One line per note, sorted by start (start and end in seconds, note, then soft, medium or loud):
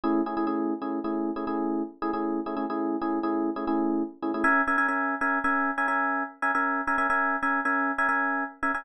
0.04 0.21 A3 medium
0.04 0.21 C#4 medium
0.04 0.21 E4 medium
0.04 0.21 G#4 medium
0.26 0.35 A3 medium
0.26 0.35 C#4 medium
0.26 0.35 E4 medium
0.26 0.35 G#4 medium
0.37 0.46 A3 medium
0.37 0.46 C#4 medium
0.37 0.46 E4 medium
0.37 0.46 G#4 medium
0.47 0.73 A3 medium
0.47 0.73 C#4 medium
0.47 0.73 E4 medium
0.47 0.73 G#4 medium
0.82 0.99 A3 medium
0.82 0.99 C#4 medium
0.82 0.99 E4 medium
0.82 0.99 G#4 medium
1.04 1.31 A3 medium
1.04 1.31 C#4 medium
1.04 1.31 E4 medium
1.04 1.31 G#4 medium
1.36 1.45 A3 medium
1.36 1.45 C#4 medium
1.36 1.45 E4 medium
1.36 1.45 G#4 medium
1.47 1.82 A3 medium
1.47 1.82 C#4 medium
1.47 1.82 E4 medium
1.47 1.82 G#4 medium
2.02 2.11 A3 medium
2.02 2.11 C#4 medium
2.02 2.11 E4 medium
2.02 2.11 G#4 medium
2.13 2.40 A3 medium
2.13 2.40 C#4 medium
2.13 2.40 E4 medium
2.13 2.40 G#4 medium
2.46 2.55 A3 medium
2.46 2.55 C#4 medium
2.46 2.55 E4 medium
2.46 2.55 G#4 medium
2.57 2.65 A3 medium
2.57 2.65 C#4 medium
2.57 2.65 E4 medium
2.57 2.65 G#4 medium
2.70 2.96 A3 medium
2.70 2.96 C#4 medium
2.70 2.96 E4 medium
2.70 2.96 G#4 medium
3.01 3.19 A3 medium
3.01 3.19 C#4 medium
3.01 3.19 E4 medium
3.01 3.19 G#4 medium
3.23 3.50 A3 medium
3.23 3.50 C#4 medium
3.23 3.50 E4 medium
3.23 3.50 G#4 medium
3.56 3.65 A3 medium
3.56 3.65 C#4 medium
3.56 3.65 E4 medium
3.56 3.65 G#4 medium
3.67 4.03 A3 medium
3.67 4.03 C#4 medium
3.67 4.03 E4 medium
3.67 4.03 G#4 medium
4.22 4.31 A3 medium
4.22 4.31 C#4 medium
4.22 4.31 E4 medium
4.22 4.31 G#4 medium
4.34 4.43 A3 medium
4.34 4.43 C#4 medium
4.34 4.43 E4 medium
4.34 4.43 G#4 medium
4.44 4.62 C#4 medium
4.44 4.62 A#4 medium
4.44 4.62 E5 loud
4.44 4.62 G#5 medium
4.67 4.76 C#4 medium
4.67 4.76 A#4 medium
4.67 4.76 E5 medium
4.67 4.76 G#5 medium
4.78 4.87 C#4 medium
4.78 4.87 A#4 medium
4.78 4.87 E5 medium
4.78 4.87 G#5 medium
4.88 5.15 C#4 medium
4.88 5.15 A#4 medium
4.88 5.15 E5 medium
4.88 5.15 G#5 medium
5.21 5.39 C#4 medium
5.21 5.39 A#4 medium
5.21 5.39 E5 medium
5.21 5.39 G#5 medium
5.44 5.71 C#4 medium
5.44 5.71 A#4 medium
5.44 5.71 E5 medium
5.44 5.71 G#5 medium
5.78 5.86 C#4 medium
5.78 5.86 A#4 medium
5.78 5.86 E5 medium
5.78 5.86 G#5 medium
5.88 6.23 C#4 medium
5.88 6.23 A#4 medium
5.88 6.23 E5 medium
5.88 6.23 G#5 medium
6.42 6.51 C#4 medium
6.42 6.51 A#4 medium
6.42 6.51 E5 medium
6.42 6.51 G#5 medium
6.55 6.81 C#4 medium
6.55 6.81 A#4 medium
6.55 6.81 E5 medium
6.55 6.81 G#5 medium
6.87 6.96 C#4 medium
6.87 6.96 A#4 medium
6.87 6.96 E5 medium
6.87 6.96 G#5 medium
6.98 7.07 C#4 medium
6.98 7.07 A#4 medium
6.98 7.07 E5 medium
6.98 7.07 G#5 medium
7.10 7.36 C#4 medium
7.10 7.36 A#4 medium
7.10 7.36 E5 medium
7.10 7.36 G#5 medium
7.43 7.60 C#4 medium
7.43 7.60 A#4 medium
7.43 7.60 E5 medium
7.43 7.60 G#5 medium
7.65 7.92 C#4 medium
7.65 7.92 A#4 medium
7.65 7.92 E5 medium
7.65 7.92 G#5 medium
7.98 8.07 C#4 medium
7.98 8.07 A#4 medium
7.98 8.07 E5 medium
7.98 8.07 G#5 medium
8.09 8.44 C#4 medium
8.09 8.44 A#4 medium
8.09 8.44 E5 medium
8.09 8.44 G#5 medium
8.63 8.72 C#4 medium
8.63 8.72 A#4 medium
8.63 8.72 E5 medium
8.63 8.72 G#5 medium
8.74 8.83 C#4 medium
8.74 8.83 A#4 medium
8.74 8.83 E5 medium
8.74 8.83 G#5 medium